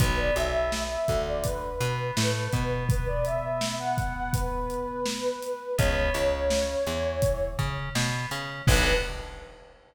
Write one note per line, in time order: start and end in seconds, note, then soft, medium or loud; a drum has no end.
0.00 0.31 B1 medium
0.00 0.33 B3 loud
0.00 0.17 B4 medium
0.00 kick loud
0.00 closed hi-hat loud
0.18 0.35 D5 medium
0.36 0.97 B1 medium
0.36 0.98 B3 medium
0.36 0.81 E5 medium
0.36 closed hi-hat medium
0.72 snare medium
0.90 1.23 E5 medium
1.08 1.70 D2 medium
1.08 1.70 D3 medium
1.08 kick medium
1.08 closed hi-hat medium
1.27 1.44 D5 medium
1.44 2.69 B4 medium
1.44 kick medium
1.44 closed hi-hat medium
1.80 2.11 B2 medium
1.80 2.11 B3 medium
1.80 closed hi-hat medium
2.17 2.48 A2 medium
2.17 2.48 A3 medium
2.17 snare loud
2.53 5.30 B2 medium
2.53 5.30 B3 medium
2.53 kick medium
2.53 closed hi-hat medium
2.89 3.06 B4 medium
2.89 kick loud
2.89 closed hi-hat medium
3.07 3.25 D5 medium
3.25 3.73 E5 medium
3.25 closed hi-hat medium
3.61 snare loud
3.80 4.13 F#5 medium
3.98 kick medium
3.98 closed hi-hat medium
4.16 4.33 F#5 medium
4.33 5.75 B4 medium
4.33 kick medium
4.33 closed hi-hat medium
4.70 closed hi-hat medium
5.06 snare loud
5.42 closed hi-hat medium
5.78 6.10 C#2 medium
5.78 6.11 B3 loud
5.78 7.45 C#5 medium
5.78 kick medium
5.78 closed hi-hat medium
6.14 6.76 C#2 medium
6.14 6.76 C#3 medium
6.14 closed hi-hat medium
6.50 snare loud
6.86 7.48 E2 medium
6.86 7.48 E3 medium
6.86 closed hi-hat medium
7.22 kick medium
7.22 closed hi-hat medium
7.59 7.89 C#3 medium
7.59 7.89 C#4 medium
7.59 kick medium
7.59 closed hi-hat medium
7.95 8.26 B2 medium
7.95 8.26 B3 medium
7.95 snare loud
8.31 8.62 C#3 medium
8.31 8.62 C#4 medium
8.31 closed hi-hat medium
8.67 8.93 B1 loud
8.67 8.92 B3 medium
8.67 8.92 D4 loud
8.67 8.92 F#4 loud
8.67 8.92 A4 loud
8.67 8.93 B4 loud
8.67 kick loud
8.67 crash loud